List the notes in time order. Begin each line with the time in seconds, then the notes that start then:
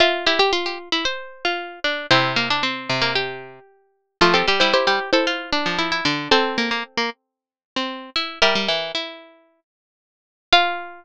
0.00 F4 E5 C6
0.26 E4 G4
0.39 G4
0.53 F4
0.66 G4
0.92 E4
1.05 C5
1.45 F4
1.84 D4
2.11 C3 C4 E4 C5
2.36 A#3
2.50 D4
2.63 C4
2.89 C3
3.02 A#3
3.15 G4
4.21 F3 A3 F4
4.34 C4 G4 A4
4.47 G3 G4
4.60 G3 E4 C5
4.73 E4 G4 C5
4.87 G3 G4
5.13 E4 A4 C5
5.27 F4
5.53 D4
5.66 F3
5.79 E4
5.92 E4
6.05 D3 D4
6.31 C4 A4 C5
6.58 A#3
6.71 A#3
6.97 A#3
7.76 C4
8.16 E4
8.42 G3 G4 A#4 E5
8.55 G3
8.68 E3
8.95 E4
10.53 F4 F5